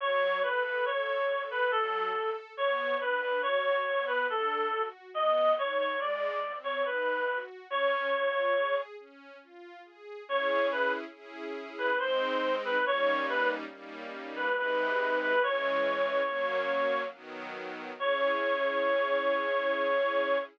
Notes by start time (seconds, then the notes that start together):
0.00 F#3 C#5
0.43 A4 B4
0.65 B4
0.85 A4 C#5
1.28 A4
1.51 B4
1.71 F#3 A4
2.14 A4
2.57 B3 C#5
3.01 D4 B4
3.21 B4
3.42 F#4 C#5
3.86 B3
4.07 B4
4.29 D4 A4
4.72 F#4
5.14 B3 D#5
5.57 D#4 C#5
5.79 C#5
6.00 G#3 D5
6.44 C4
6.64 C#5
6.85 D#4 B4
7.28 F#4
7.70 C#4 C#5
8.15 F4
8.57 G#4
8.99 C#4
9.43 F4
9.85 G#4
10.28 C#4 E4 G#4 C#5
10.72 B4
11.14 C#4 E4 G#4
11.78 B4
11.99 G#3 C4 D#4 C5
12.65 B4
12.86 G3 A#3 C#4 D#4 C#5
13.29 B4
13.72 G3 A#3 C#4 D#4
14.36 B4
14.57 C3 G#3 D#4 B4
15.22 B4
15.43 E3 G#3 C#4 C#5
16.27 F#3 A#3 C#4
17.14 D#3 F#3 B3
17.99 C#4 E4 G#4 C#5